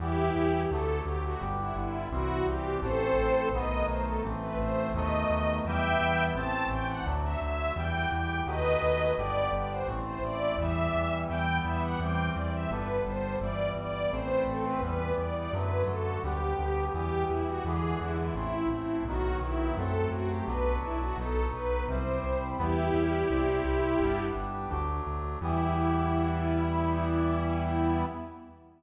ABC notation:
X:1
M:4/4
L:1/16
Q:1/4=85
K:Em
V:1 name="String Ensemble 1"
[EG]4 A2 G F z E E2 F2 G2 | [Ac]4 ^d2 c A z B c2 d4 | [eg]4 a2 g f z e e2 g2 g2 | [B^d]4 =d2 d c z c d2 e4 |
g2 e f g2 d e B2 c2 d2 d2 | c2 A B B2 d d B2 A2 G4 | G2 E F ^G2 E E E2 E2 F2 E2 | A2 F G B2 E F A2 B2 c4 |
[EG]10 z6 | E16 |]
V:2 name="Brass Section"
[E,G,B,]4 [D,F,A,]4 [D,G,B,]4 [E,G,C]4 | [E,A,C]4 [^D,F,A,B,]4 [E,A,C]4 [D,F,A,B,]4 | [E,G,B,]4 [E,A,C]4 [D,F,A,]4 [E,G,B,]4 | [^D,F,A,B,]4 [=D,G,B,]4 [E,A,C]4 [E,G,B,]4 |
[E,G,B,]4 [E,G,C]4 [D,G,B,]4 [E,G,B,]4 | [E,A,C]4 [E,G,B,]4 [D,F,A,]4 [D,G,B,]4 | [E,G,B,]4 [D,E,^G,B,]4 [E,A,C]4 [^D,F,B,]4 | [F,A,C]4 [F,B,D]4 [F,B,^D]4 [G,CE]4 |
[G,B,E]4 [G,CE]4 [G,B,D]4 [F,A,D]4 | [E,G,B,]16 |]
V:3 name="Synth Bass 1" clef=bass
E,,2 E,,2 D,,2 D,,2 G,,,2 G,,,2 C,,2 C,,2 | A,,,2 A,,,2 B,,,2 B,,,2 A,,,2 A,,,2 ^D,,2 D,,2 | E,,2 E,,2 A,,,2 A,,,2 D,,2 D,,2 E,,2 E,,2 | ^D,,2 D,,2 G,,,2 G,,,2 A,,,2 A,,,2 E,,2 E,,2 |
E,,2 E,,2 E,,2 E,,2 G,,,2 G,,,2 G,,,2 G,,,2 | A,,,2 A,,,2 E,,2 E,,2 F,,2 F,,2 D,,2 D,,2 | E,,2 E,,2 E,,2 E,,2 A,,,2 A,,,2 B,,,2 B,,,2 | F,,2 F,,2 B,,,2 B,,,2 B,,,2 B,,,2 C,,2 C,,2 |
E,,2 E,,2 C,,2 C,,2 G,,,2 G,,,2 D,,2 D,,2 | E,,16 |]